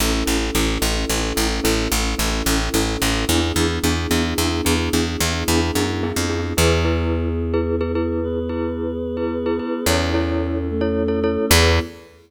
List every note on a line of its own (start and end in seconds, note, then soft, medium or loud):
0.00 0.24 A1 medium
0.00 3.25 C#4 medium
0.00 0.12 C#4 medium
0.00 3.25 E4 medium
0.00 0.12 E4 medium
0.00 3.25 A4 medium
0.00 0.12 A4 medium
0.26 0.51 A1 medium
0.26 0.37 C#4 medium
0.26 0.37 E4 medium
0.26 0.37 A4 medium
0.55 0.78 A1 medium
0.55 0.66 C#4 medium
0.55 0.66 E4 medium
0.55 0.66 A4 medium
0.82 1.05 A1 medium
0.82 0.93 C#4 medium
0.82 0.93 E4 medium
0.82 0.93 A4 medium
1.09 1.33 A1 medium
1.09 1.21 C#4 medium
1.09 1.21 E4 medium
1.09 1.21 A4 medium
1.36 1.60 A1 medium
1.36 1.47 C#4 medium
1.36 1.47 E4 medium
1.36 1.47 A4 medium
1.64 1.88 A1 medium
1.64 1.75 C#4 medium
1.64 1.75 E4 medium
1.64 1.75 A4 medium
1.92 2.15 A1 medium
1.92 2.03 C#4 medium
1.92 2.03 E4 medium
1.92 2.03 A4 medium
2.18 2.42 A1 medium
2.18 2.29 C#4 medium
2.18 2.29 E4 medium
2.18 2.29 A4 medium
2.46 2.69 A1 medium
2.46 2.59 C#4 medium
2.46 2.59 E4 medium
2.46 2.59 A4 medium
2.74 2.97 A1 medium
2.74 2.86 C#4 medium
2.74 2.86 E4 medium
2.74 2.86 A4 medium
3.02 3.25 A1 medium
3.02 3.13 C#4 medium
3.02 3.13 E4 medium
3.02 3.13 A4 medium
3.29 3.52 E2 medium
3.29 6.54 B3 medium
3.29 3.40 B3 medium
3.29 6.54 D4 medium
3.29 3.40 D4 medium
3.29 6.54 E4 medium
3.29 3.40 E4 medium
3.29 6.54 G#4 medium
3.29 3.40 G#4 medium
3.56 3.79 E2 medium
3.56 3.67 B3 medium
3.56 3.67 D4 medium
3.56 3.67 E4 medium
3.56 3.67 G#4 medium
3.84 4.07 E2 medium
3.84 3.95 B3 medium
3.84 3.95 D4 medium
3.84 3.95 E4 medium
3.84 3.95 G#4 medium
4.11 4.34 E2 medium
4.11 4.22 B3 medium
4.11 4.22 D4 medium
4.11 4.22 E4 medium
4.11 4.22 G#4 medium
4.38 4.61 E2 medium
4.38 4.49 B3 medium
4.38 4.49 D4 medium
4.38 4.49 E4 medium
4.38 4.49 G#4 medium
4.65 4.89 E2 medium
4.65 4.76 B3 medium
4.65 4.76 D4 medium
4.65 4.76 E4 medium
4.65 4.76 G#4 medium
4.93 5.17 E2 medium
4.93 5.04 B3 medium
4.93 5.04 D4 medium
4.93 5.04 E4 medium
4.93 5.04 G#4 medium
5.20 5.44 E2 medium
5.20 5.32 B3 medium
5.20 5.32 D4 medium
5.20 5.32 E4 medium
5.20 5.32 G#4 medium
5.48 5.71 E2 medium
5.48 5.60 B3 medium
5.48 5.60 D4 medium
5.48 5.60 E4 medium
5.48 5.60 G#4 medium
5.75 6.12 F#2 medium
5.75 5.86 B3 medium
5.75 5.86 D4 medium
5.75 5.86 E4 medium
5.75 5.86 G#4 medium
6.03 6.14 B3 medium
6.03 6.14 D4 medium
6.03 6.14 E4 medium
6.03 6.14 G#4 medium
6.16 6.53 F2 medium
6.30 6.41 B3 medium
6.30 6.41 D4 medium
6.30 6.41 E4 medium
6.30 6.41 G#4 medium
6.57 9.60 E2 medium
6.57 8.20 B3 medium
6.57 8.20 E4 medium
6.57 6.79 E4 loud
6.57 8.20 G#4 medium
6.57 6.79 G#4 medium
6.57 6.79 B4 loud
6.85 7.29 E4 medium
6.85 7.29 G#4 medium
6.85 7.29 B4 medium
7.54 7.75 E4 medium
7.54 7.75 G#4 medium
7.54 7.75 B4 medium
7.81 7.92 E4 medium
7.81 7.92 G#4 loud
7.81 7.92 B4 medium
7.95 8.39 E4 medium
7.95 8.39 G#4 medium
7.95 8.39 B4 medium
8.22 9.85 B3 medium
8.22 9.85 G#4 medium
8.22 9.85 B4 medium
8.49 8.93 E4 medium
8.49 8.93 G#4 medium
8.49 8.93 B4 medium
9.17 9.39 E4 medium
9.17 9.39 G#4 medium
9.17 9.39 B4 medium
9.46 9.57 E4 medium
9.46 9.57 G#4 medium
9.46 9.57 B4 medium
9.59 9.81 E4 medium
9.59 9.81 G#4 medium
9.59 9.81 B4 medium
9.86 11.38 E2 medium
9.86 10.68 C#4 medium
9.86 10.08 E4 medium
9.86 10.68 E4 medium
9.86 10.08 A4 loud
9.86 10.68 A4 medium
9.86 10.08 C#5 medium
10.14 10.58 E4 medium
10.14 10.58 A4 medium
10.14 10.58 C#5 medium
10.69 11.50 A3 medium
10.69 11.50 C#4 medium
10.69 11.50 A4 medium
10.81 11.03 E4 medium
10.81 11.03 A4 medium
10.81 11.03 C#5 medium
11.08 11.19 E4 medium
11.08 11.19 A4 medium
11.08 11.19 C#5 medium
11.24 11.46 E4 medium
11.24 11.46 A4 loud
11.24 11.46 C#5 medium
11.50 11.80 E2 loud
11.50 11.80 B3 loud
11.50 11.79 E4 loud
11.50 11.80 E4 loud
11.50 11.79 G#4 loud
11.50 11.80 G#4 medium
11.50 11.79 B4 loud